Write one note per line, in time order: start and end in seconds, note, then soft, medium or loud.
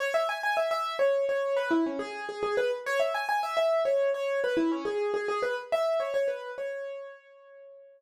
0.00 0.14 C#5 medium
0.14 0.28 E5 medium
0.29 0.43 G#5 medium
0.43 0.57 G#5 medium
0.57 0.70 E5 medium
0.71 0.96 E5 medium
0.99 1.25 C#5 medium
1.29 1.57 C#5 medium
1.57 1.70 B4 medium
1.71 1.84 E4 medium
1.86 2.00 C#4 medium
1.99 2.25 G#4 medium
2.29 2.42 G#4 medium
2.43 2.56 G#4 medium
2.57 2.71 B4 medium
2.86 3.00 C#5 medium
3.00 3.13 E5 medium
3.14 3.28 G#5 medium
3.29 3.42 G#5 medium
3.43 3.56 E5 medium
3.57 3.83 E5 medium
3.85 4.10 C#5 medium
4.14 4.40 C#5 medium
4.44 4.57 B4 medium
4.57 4.70 E4 medium
4.72 4.85 C#4 medium
4.85 5.12 G#4 medium
5.14 5.27 G#4 medium
5.28 5.42 G#4 medium
5.43 5.56 B4 medium
5.72 6.00 E5 medium
6.00 6.13 C#5 medium
6.14 6.28 C#5 medium
6.28 6.51 B4 medium
6.58 8.01 C#5 medium